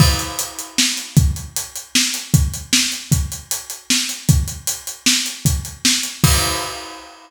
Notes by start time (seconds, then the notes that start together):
0.00 kick, crash
0.19 closed hi-hat
0.39 closed hi-hat
0.59 closed hi-hat
0.78 snare
0.97 closed hi-hat
1.17 kick, closed hi-hat
1.36 closed hi-hat
1.56 closed hi-hat
1.76 closed hi-hat
1.95 snare
2.14 closed hi-hat
2.34 kick, closed hi-hat
2.54 closed hi-hat
2.73 snare
2.92 closed hi-hat
3.12 kick, closed hi-hat
3.32 closed hi-hat
3.51 closed hi-hat
3.70 closed hi-hat
3.90 snare
4.09 closed hi-hat
4.29 kick, closed hi-hat
4.48 closed hi-hat
4.67 closed hi-hat
4.87 closed hi-hat
5.06 snare
5.26 closed hi-hat
5.45 kick, closed hi-hat
5.65 closed hi-hat
5.85 snare
6.03 closed hi-hat
6.24 kick, crash